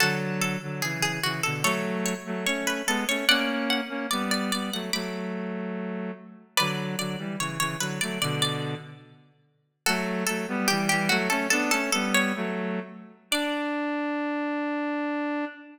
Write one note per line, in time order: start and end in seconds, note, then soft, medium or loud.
0.00 0.57 D3 medium
0.00 0.57 F#3 medium
0.00 0.37 F#4 medium
0.00 0.37 A4 medium
0.41 0.76 A4 medium
0.62 0.82 D3 medium
0.62 0.82 F#3 medium
0.82 1.20 C#3 medium
0.82 1.20 E3 medium
0.82 0.99 G#4 medium
1.02 1.20 G#4 medium
1.23 1.42 C#3 medium
1.23 1.42 E3 medium
1.23 1.41 F#4 medium
1.43 1.65 B2 medium
1.43 1.65 D3 medium
1.43 1.62 A4 medium
1.63 2.14 F#3 medium
1.63 2.14 A3 medium
1.63 2.04 A4 medium
1.63 2.04 C#5 loud
2.06 2.45 C#5 medium
2.26 2.46 F#3 medium
2.26 2.45 A3 medium
2.46 2.82 A3 medium
2.46 2.82 C#4 medium
2.46 2.63 C#5 medium
2.67 2.85 B4 medium
2.87 3.04 G#3 medium
2.87 3.04 B3 medium
2.87 3.06 A4 medium
3.08 3.25 A3 medium
3.08 3.25 C#4 medium
3.08 3.27 C#5 medium
3.28 3.81 A#3 medium
3.28 3.81 C#4 medium
3.28 3.68 D5 loud
3.28 3.68 F#5 loud
3.70 4.07 F#5 medium
3.89 4.07 A#3 medium
3.89 4.07 C#4 medium
4.11 4.51 G3 medium
4.11 4.51 B3 medium
4.11 4.29 D5 medium
4.31 4.48 D5 medium
4.52 4.70 G3 medium
4.52 4.70 B3 medium
4.52 4.70 D5 medium
4.73 4.91 F#3 medium
4.73 4.91 A3 medium
4.73 4.91 F#5 medium
4.93 6.11 F#3 medium
4.93 6.11 A3 medium
4.93 6.25 B5 medium
4.93 6.25 D6 loud
6.57 6.96 D3 medium
6.57 6.96 F#3 medium
6.57 6.91 B4 medium
6.57 6.91 D5 loud
6.98 7.16 D3 medium
6.98 7.16 F#3 medium
6.98 7.32 D5 medium
7.18 7.36 E3 medium
7.18 7.36 G3 medium
7.39 7.58 C#3 medium
7.39 7.58 E3 medium
7.39 7.59 C#5 medium
7.59 7.76 C#3 medium
7.59 7.76 E3 medium
7.59 7.77 C#5 loud
7.79 7.99 D3 medium
7.79 7.99 F#3 medium
7.79 7.99 B4 medium
8.01 8.19 F#3 medium
8.01 8.19 A3 medium
8.01 8.17 D5 medium
8.22 8.75 B2 medium
8.22 8.75 D3 medium
8.22 8.41 D5 medium
8.42 9.01 D5 medium
9.86 10.24 F#3 medium
9.86 10.24 A3 medium
9.86 10.25 F#4 medium
9.86 10.25 A4 loud
10.27 10.46 F#3 medium
10.27 10.46 A3 medium
10.27 10.66 A4 loud
10.48 10.68 G3 medium
10.48 10.68 B3 medium
10.68 10.89 E3 medium
10.68 10.89 G3 medium
10.68 10.87 G4 loud
10.89 11.09 E3 medium
10.89 11.09 G3 medium
10.89 11.06 G4 loud
11.09 11.28 F#3 medium
11.09 11.28 A3 medium
11.09 11.29 F#4 medium
11.30 11.47 A3 medium
11.30 11.47 C#4 medium
11.30 11.47 A4 medium
11.50 11.71 B3 medium
11.50 11.71 D4 medium
11.50 11.69 A4 loud
11.71 11.90 A3 medium
11.71 11.90 C#4 medium
11.71 11.92 A4 loud
11.92 12.32 G3 medium
11.92 12.32 B3 medium
11.92 12.12 A4 medium
12.14 12.97 C#5 loud
12.36 12.80 F#3 medium
12.36 12.80 A3 medium
13.31 15.45 D4 loud
13.31 15.46 D5 loud